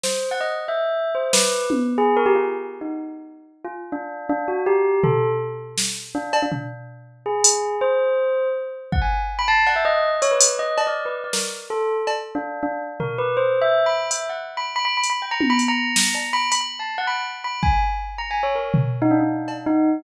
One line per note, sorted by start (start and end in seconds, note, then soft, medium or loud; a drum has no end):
0.03 0.29 C5 medium
0.03 snare medium
0.31 0.40 F#5 medium
0.41 0.49 D#5 medium
0.68 1.10 E5 medium
1.15 1.31 C5 medium
1.33 1.66 B4 medium
1.33 snare medium
1.70 high tom medium
1.98 2.15 G#4 loud
2.17 2.25 A#4 loud
2.26 2.34 G4 loud
2.35 2.43 F4 medium
2.81 2.90 D#4 medium
3.65 3.73 F4 medium
3.92 4.26 D4 medium
4.29 4.46 D4 loud
4.48 4.65 F#4 medium
4.66 5.00 G4 loud
5.03 5.29 A4 medium
5.03 floor tom medium
5.78 snare medium
6.15 6.40 D4 medium
6.33 cowbell loud
6.42 6.51 D4 medium
6.52 6.60 D4 medium
6.52 floor tom medium
7.26 7.76 G#4 medium
7.44 closed hi-hat loud
7.81 8.48 C5 medium
8.92 9.01 F#5 medium
8.92 kick medium
9.02 9.18 G#5 medium
9.39 9.47 B5 loud
9.48 9.65 A5 loud
9.66 9.75 F#5 medium
9.66 cowbell medium
9.76 9.84 E5 medium
9.85 10.10 D#5 loud
10.22 10.30 C#5 loud
10.22 closed hi-hat medium
10.31 10.56 B4 medium
10.41 closed hi-hat loud
10.59 10.84 D#5 medium
10.78 cowbell medium
10.87 11.04 D5 medium
11.05 11.14 B4 medium
11.24 11.32 D5 soft
11.33 11.41 A#4 medium
11.33 snare medium
11.70 11.95 A4 medium
12.07 cowbell medium
12.35 12.60 D4 medium
12.63 12.79 D4 medium
13.00 13.17 A#4 medium
13.00 floor tom medium
13.18 13.35 B4 medium
13.37 13.59 C5 medium
13.61 13.84 E5 loud
13.86 14.08 B5 medium
14.11 14.28 E5 medium
14.11 closed hi-hat medium
14.29 14.38 F#5 soft
14.57 14.66 B5 medium
14.76 14.84 B5 loud
14.85 14.96 B5 loud
14.97 15.08 B5 medium
15.03 closed hi-hat medium
15.10 15.21 B5 medium
15.22 15.30 G5 medium
15.31 15.48 A#5 loud
15.41 high tom medium
15.50 15.58 B5 loud
15.59 closed hi-hat medium
15.68 16.27 A#5 loud
15.96 snare medium
16.15 cowbell medium
16.33 16.50 B5 loud
16.52 16.60 B5 loud
16.52 closed hi-hat medium
16.61 16.78 B5 medium
16.79 16.96 A5 medium
16.98 17.06 F#5 medium
17.07 17.24 B5 medium
17.44 17.61 B5 medium
17.63 17.79 G#5 medium
17.63 kick medium
18.18 18.29 A#5 medium
18.31 18.42 G#5 medium
18.43 18.54 C#5 medium
18.55 18.72 A#4 medium
18.74 floor tom medium
19.02 19.10 D#4 loud
19.11 19.19 D4 medium
19.20 19.62 D4 medium
19.48 cowbell medium
19.66 20.00 D#4 loud